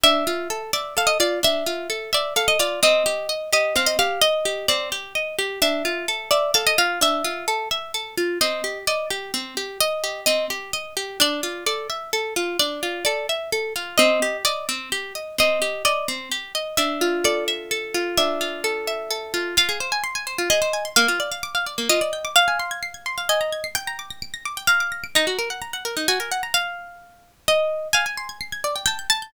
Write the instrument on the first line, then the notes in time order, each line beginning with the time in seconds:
orchestral harp
0.03 D4 E5
0.27 F4
0.50 A4
0.73 D5 E5
0.97 A4 F5
1.07 D#5
1.20 F4 D5
1.43 D4 E5
1.66 F4
1.90 A4
2.13 D5 E5
2.36 A4 F5
2.48 D#5
2.59 F4 D5
2.83 C4 D#5
3.06 G4
3.29 D#5
3.53 G4 D#5
3.76 C4 F5
3.86 D#5
3.99 G4 F5
4.22 D#5
4.45 G4
4.68 C4 D5
4.92 G4
5.15 D#5
5.39 G4
5.62 D4 E5
5.85 F4
6.08 A4
6.31 D5 E5
6.54 A4 F5
6.67 D#5
6.78 F4 F5
7.01 D4 E5
7.24 F4
7.48 A4
7.71 E5
7.94 A4
8.18 F4
8.41 C4 D#5
8.64 G4
8.87 D5 D#5
9.10 G4
9.34 C4
9.57 G4
9.80 D#5
10.04 G4
10.26 C4 D#5
10.50 G4
10.73 D#5
10.97 G4
11.20 D4 D5
11.43 F4
11.66 A4 D5
11.90 E5
12.13 A4
12.36 F4
12.59 D4 D5
12.83 F4
13.05 A4 D5
13.29 E5
13.52 A4
13.76 F4
13.98 C4 D#5
14.22 G4
14.45 D5 D#5
14.69 C4
14.92 G4
15.15 D#5
15.38 C4 D#5
15.62 G4
15.85 D5 D#5
16.08 C4
16.31 G4
16.55 D#5
16.77 D4 E5
17.01 F4
17.24 A4 D5
17.48 E5
17.71 A4
17.94 F4
18.17 D4 E5
18.41 F4
18.64 A4
18.87 E5
19.10 A4
19.34 F4
19.57 F4 F5
19.69 G#4
19.80 C5
19.92 G#5
20.04 C6
20.15 G#5
20.27 C5
20.38 F4
20.50 G#4 D#5
20.62 C5
20.73 G#5
20.85 C6
20.96 A#3 F5
21.08 F4
21.20 D5
21.32 F5
21.43 D6
21.55 F5
21.66 D5
21.78 A#3
21.89 F4 D#5
22.01 D5
22.13 G5
22.25 D6
22.36 F5
22.48 G#5
22.59 C6
22.71 G#6
22.83 C7
22.94 G#6
23.06 C6
23.18 F5
23.29 D#5 G#5
23.41 A#5
23.53 G#6
23.64 C7
23.75 G5
23.87 A#5
23.99 D6
24.10 A#6
24.22 D7
24.34 A#6
24.45 D6
24.57 G5
24.67 F5 A#5
24.80 D6
24.92 A#6
25.04 D7
25.15 D#4 A#5
25.27 F#4
25.39 A#4
25.50 F#5
25.62 A#5
25.73 F#5
25.85 A#4
25.97 D#4
26.08 F#4 G#5
26.20 A#4
26.31 F#5
26.43 A#5
26.54 F5
27.48 D#5
27.93 F5 G#5
28.06 G#5
28.17 C6
28.29 G#6
28.41 C7
28.52 G#6
28.64 D5
28.76 G5
28.86 G5 A5
28.99 G6
29.10 A5 A6
29.22 G6